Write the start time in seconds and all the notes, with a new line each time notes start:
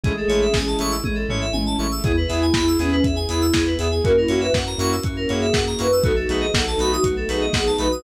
0.04 A1 G#3 A3 C#4 E4 G#4, kick, closed hi-hat
0.17 A4
0.28 A1 G#3 A3 C#4 E4 C#5, open hi-hat
0.41 E5
0.54 A1 G#5, kick, snare
0.67 A5
0.79 A1 G#3 A3 C#4 E4 C#6, open hi-hat
0.91 E6
1.04 A1 G#4, kick, high tom
1.15 A4
1.29 A1 G#3 A3 C#4 E4 C#5, floor tom
1.41 E5
1.53 A1 G#5, high tom
1.66 A5
1.79 A1 G#3 A3 C#4 E4 C#6
1.91 E6
2.04 E2 B3 E4 G#4, kick, closed hi-hat
2.17 B4
2.28 E2 B3 E4 G#4 E5, open hi-hat
2.42 G#5
2.54 E2 E4 B5, kick, snare
2.68 E6
2.79 E2 B3 C#4 E4 G#4, open hi-hat
2.91 C#4 B4
3.04 E2 E5, kick, closed hi-hat
3.16 G#5
3.29 E2 B3 E4 G#4 B5, open hi-hat
3.41 E6
3.53 E2 G#4, kick, snare
3.67 B4
3.78 E2 B3 E4 G#4 E5, open hi-hat
3.91 G#5
4.04 F#2 A#3 C#4 E4 F#4 A#4, kick, closed hi-hat
4.16 E4 A#4
4.28 F#2 A#3 C#4 E4 F#4 C#5, open hi-hat
4.41 B4 E5
4.53 F#2 F#5, kick, snare
4.66 A#5
4.78 F#2 A#3 C#4 E4 F#4 C#6, open hi-hat
4.92 E6
5.04 F#2 F#4, kick, closed hi-hat
5.17 A#4
5.29 F#2 A#3 C#4 E4 F#4 G#4 C#5, open hi-hat
5.41 E5
5.53 F#2 F#5, kick, snare
5.67 A#5
5.79 F#2 A#3 C#4 E4 F#4 B4 C#6, open hi-hat
5.92 E6
6.04 B1 A3 B3 D#4 F#4 A4, kick, closed hi-hat
6.16 A4
6.28 B1 A3 B3 D#4 F#4 G#4 B4, open hi-hat
6.41 D#5
6.54 B1 A4 F#5, kick, snare
6.67 A5
6.78 B1 A3 B3 D#4 F#4 B5, open hi-hat
6.92 F#4 D#6
7.03 B1 F#4, kick, closed hi-hat
7.17 A4
7.29 B1 A3 B3 D#4 F#4 G#4 B4, open hi-hat
7.41 D#5
7.53 B1 F#5, kick, snare
7.66 A5
7.78 B1 A3 B3 D#4 F#4 B4 B5, open hi-hat
7.92 D#6